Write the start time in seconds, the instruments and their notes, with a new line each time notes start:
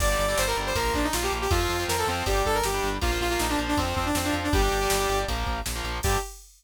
0.00 synth bass 1 G1, overdriven guitar D3 G3, lead 2 (sawtooth) D5, kick, crash
0.09 overdriven guitar D3 G3
0.19 synth bass 1 G1, lead 2 (sawtooth) D5, ride
0.28 overdriven guitar D3 G3, lead 2 (sawtooth) D5
0.38 synth bass 1 G1, lead 2 (sawtooth) C5, snare
0.47 overdriven guitar D3 G3, lead 2 (sawtooth) A#4
0.57 synth bass 1 G1, overdriven guitar D3 G3, ride
0.66 lead 2 (sawtooth) C5
0.75 synth bass 1 A#1, overdriven guitar F3 A#3, lead 2 (sawtooth) A#4, kick, ride
0.94 synth bass 1 A#1, lead 2 (sawtooth) D4, kick, ride
1.04 lead 2 (sawtooth) D#4
1.13 synth bass 1 A#1, lead 2 (sawtooth) F4, snare
1.23 overdriven guitar F3 A#3, lead 2 (sawtooth) G4
1.32 synth bass 1 A#1, ride
1.41 lead 2 (sawtooth) G4
1.51 synth bass 1 F2, overdriven guitar F3 C4, lead 2 (sawtooth) F4, kick, ride
1.60 overdriven guitar F3 C4
1.69 synth bass 1 F2, ride
1.79 overdriven guitar F3 C4
1.88 synth bass 1 F2, lead 2 (sawtooth) A#4, snare
1.98 overdriven guitar F3 C4, lead 2 (sawtooth) A4
2.07 synth bass 1 F2, overdriven guitar F3 C4, lead 2 (sawtooth) C4, ride
2.26 synth bass 1 G1, overdriven guitar G3 D4, lead 2 (sawtooth) G4, kick, ride
2.45 synth bass 1 G1, lead 2 (sawtooth) A4, kick, ride
2.54 lead 2 (sawtooth) A#4
2.63 synth bass 1 G1, lead 2 (sawtooth) G4, snare
2.74 overdriven guitar G3 D4
2.83 synth bass 1 G1, ride
3.01 synth bass 1 A#1, overdriven guitar F3 A#3, lead 2 (sawtooth) F4, kick, ride
3.11 overdriven guitar F3 A#3
3.21 synth bass 1 A#1, lead 2 (sawtooth) F4, ride
3.30 overdriven guitar F3 A#3, lead 2 (sawtooth) F4
3.39 synth bass 1 A#1, lead 2 (sawtooth) D#4, snare
3.49 overdriven guitar F3 A#3, lead 2 (sawtooth) D4
3.58 synth bass 1 A#1, overdriven guitar F3 A#3, ride
3.68 lead 2 (sawtooth) D4
3.77 synth bass 1 F2, overdriven guitar F3 C4, lead 2 (sawtooth) C4, kick, ride
3.96 synth bass 1 F2, lead 2 (sawtooth) C4, kick, ride
4.06 lead 2 (sawtooth) D4
4.15 synth bass 1 F2, lead 2 (sawtooth) C4, snare
4.24 overdriven guitar F3 C4, lead 2 (sawtooth) D4
4.33 synth bass 1 F2, ride
4.44 lead 2 (sawtooth) D4
4.53 synth bass 1 G1, overdriven guitar G3 D4, lead 2 (sawtooth) G4, kick, ride
4.62 overdriven guitar G3 D4
4.71 synth bass 1 G1, ride
4.81 overdriven guitar G3 D4
4.90 synth bass 1 G1, snare
5.00 overdriven guitar G3 D4
5.09 synth bass 1 G1, overdriven guitar G3 D4, ride
5.28 synth bass 1 A#1, overdriven guitar F3 A#3, kick, ride
5.46 synth bass 1 A#1, kick, ride
5.66 synth bass 1 A#1, snare
5.75 overdriven guitar F3 A#3
5.84 synth bass 1 A#1, ride
6.03 synth bass 1 G2, overdriven guitar D3 G3, lead 2 (sawtooth) G4, kick, crash